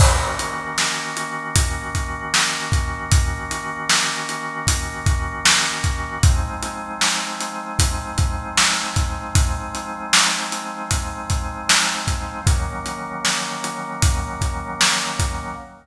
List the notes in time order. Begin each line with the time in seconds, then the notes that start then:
0.00 D#3 A#3 C#4 F#4, kick, crash
0.39 closed hi-hat
0.78 snare
1.17 closed hi-hat
1.56 kick, closed hi-hat
1.95 kick, closed hi-hat
2.34 snare
2.72 kick, closed hi-hat
3.12 kick, closed hi-hat
3.51 closed hi-hat
3.89 snare
4.29 closed hi-hat
4.67 kick, closed hi-hat
5.06 kick, closed hi-hat
5.45 snare
5.84 kick, closed hi-hat
6.23 F3 G#3 C4 D#4, kick, closed hi-hat
6.63 closed hi-hat
7.01 snare
7.40 closed hi-hat
7.79 kick, closed hi-hat
8.18 kick, closed hi-hat
8.57 snare
8.96 kick, closed hi-hat
9.35 kick, closed hi-hat
9.75 closed hi-hat
10.13 snare
10.52 closed hi-hat
10.91 kick, closed hi-hat
11.30 kick, closed hi-hat
11.69 snare
12.07 kick, closed hi-hat
12.46 D#3 F#3 A#3 C#4, kick, closed hi-hat
12.86 closed hi-hat
13.25 snare
13.64 closed hi-hat
14.02 kick, closed hi-hat
14.41 kick, closed hi-hat
14.81 snare
15.19 kick, closed hi-hat